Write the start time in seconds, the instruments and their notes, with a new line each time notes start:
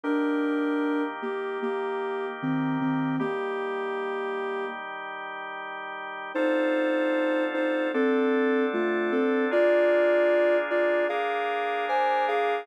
0.04 drawbar organ D#3 A#3 G4, ocarina D4 A#4
1.22 ocarina A#3 G4
1.62 ocarina A#3 G4
2.42 ocarina D#3 C4
2.81 ocarina D#3 C4
3.20 drawbar organ D#3 G3 G4, ocarina A#3 G4
6.35 drawbar organ D3 C4 F4 A4, ocarina D#4 C5
7.54 ocarina D#4 C5
7.94 drawbar organ D3 C4 D4 A4, ocarina C4 A4
8.73 ocarina A3 F4
9.12 ocarina C4 A4
9.51 drawbar organ A#3 D4 F4 G#4, ocarina F4 D5
10.70 ocarina F4 D5
11.09 drawbar organ A#3 D4 G#4 A#4, ocarina G#4 F5
11.89 ocarina C5 G#5
12.28 ocarina G#4 F5